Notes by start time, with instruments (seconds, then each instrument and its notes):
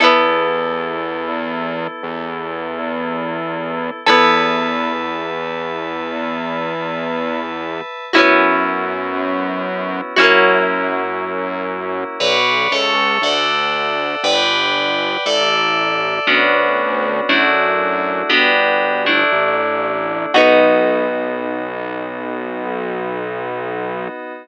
0.00 synth bass 1 E2, electric piano 2 B3 E4 A4, acoustic guitar (steel) B3 E4 A4
2.03 synth bass 1 E2
4.06 synth bass 1 E2, acoustic guitar (steel) B3 E4 A4, electric piano 2 B4 E5 A5
8.13 synth bass 1 F#2, electric piano 2 B3 C#4 E4 F#4, acoustic guitar (steel) C#4 E4 F#4
8.18 acoustic guitar (steel) B3
10.16 synth bass 1 F#2, electric piano 2 A#3 C#4 E4 F#4, acoustic guitar (steel) C#4 E4 F#4
10.21 acoustic guitar (steel) A#3
12.20 synth bass 1 B1, electric piano 2 B4 C#5 D5 F#5
12.71 synth bass 1 C#2, electric piano 2 A4 C#5 E5
13.22 synth bass 1 D2, electric piano 2 A4 D5 E5 F#5
14.24 synth bass 1 G1, electric piano 2 B4 D5 F#5 G5
15.26 synth bass 1 A1, electric piano 2 A4 D5 E5
16.27 synth bass 1 D2, electric piano 2 B3 C#4 D4 F#4
17.29 synth bass 1 F#2, electric piano 2 A3 D4 E4 F#4
18.29 synth bass 1 G1, electric piano 2 B3 D4 F#4 G4
19.06 electric piano 2 A3 D4 E4
19.32 synth bass 1 A1
20.34 synth bass 1 B1, electric piano 2 B3 D#4 F#4, acoustic guitar (steel) B3 D#4 F#4